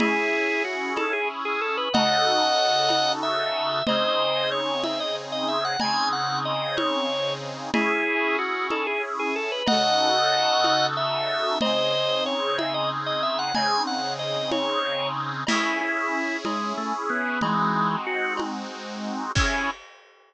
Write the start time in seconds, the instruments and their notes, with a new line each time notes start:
0.00 accordion C#4 E4 G#4, drawbar organ E4 G#4, cowbell, low conga
0.65 drawbar organ F#4
0.96 drawbar organ A4, cowbell, high conga
1.13 drawbar organ G#4
1.45 drawbar organ G#4
1.61 drawbar organ A4
1.77 drawbar organ B4
1.93 accordion C#3 D#4 F#4 A4, drawbar organ D#5 F#5, cowbell, low conga
2.89 cowbell, high conga
3.23 drawbar organ E5
3.87 accordion C#3 C4 D#4 G#4, drawbar organ C5 D#5, cowbell, low conga
4.52 drawbar organ C#5
4.84 drawbar organ E5, cowbell, high conga
5.00 drawbar organ D#5
5.32 drawbar organ D#5
5.48 drawbar organ E5
5.65 drawbar organ F#5
5.80 accordion C#3 C4 D#4 G#4, drawbar organ G#5, cowbell, low conga
6.13 drawbar organ F#5
6.45 drawbar organ D#5
6.77 drawbar organ C#5, cowbell, high conga
7.73 accordion C#4 E4 G#4, drawbar organ E4 G#4, cowbell, low conga
8.39 drawbar organ F#4
8.70 drawbar organ A4, cowbell, high conga
8.87 drawbar organ G#4
9.19 drawbar organ G#4
9.36 drawbar organ A4
9.52 drawbar organ B4
9.67 accordion C#3 D#4 F#4 A4, drawbar organ D#5 F#5, cowbell, low conga
10.64 cowbell, high conga
10.97 drawbar organ E5
11.61 accordion C#3 C4 D#4 G#4, drawbar organ C5 D#5, cowbell, low conga
12.26 drawbar organ C#5
12.58 drawbar organ E5, cowbell, high conga
12.74 drawbar organ D#5
13.06 drawbar organ D#5
13.23 drawbar organ E5
13.39 drawbar organ F#5
13.55 accordion C#3 C4 D#4 G#4, drawbar organ G#5, cowbell, low conga
13.87 drawbar organ F#5
14.19 drawbar organ D#5
14.51 drawbar organ C#5, cowbell, high conga
15.47 accordion C#4 E4 G#4, drawbar organ E4, crash, cowbell, low conga
15.81 drawbar organ E4
16.45 drawbar organ G#3, cowbell, high conga
16.77 drawbar organ A3
17.10 drawbar organ B3
17.41 drawbar organ E3 G#3, accordion G#3 C4 D#4 F#4, cowbell, low conga
18.07 drawbar organ F#4
18.37 cowbell, high conga
19.35 drawbar organ C#4, accordion C#4 E4 G#4, kick, crash